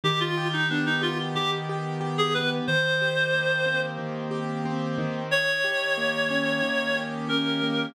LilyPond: <<
  \new Staff \with { instrumentName = "Clarinet" } { \time 4/4 \key ees \major \tempo 4 = 91 g'16 f'8 ees'16 d'16 ees'16 f'16 r16 g'16 r4 aes'16 b'16 r16 | c''2 r2 | des''2. bes'4 | }
  \new Staff \with { instrumentName = "Acoustic Grand Piano" } { \time 4/4 \key ees \major ees8 g'8 b8 g'8 ees8 g'8 g'8 b8 | ees8 g'8 bes8 c'8 ees8 g'8 c'8 ees8~ | ees8 g'8 bes8 des'8 ees8 g'8 des'8 bes8 | }
>>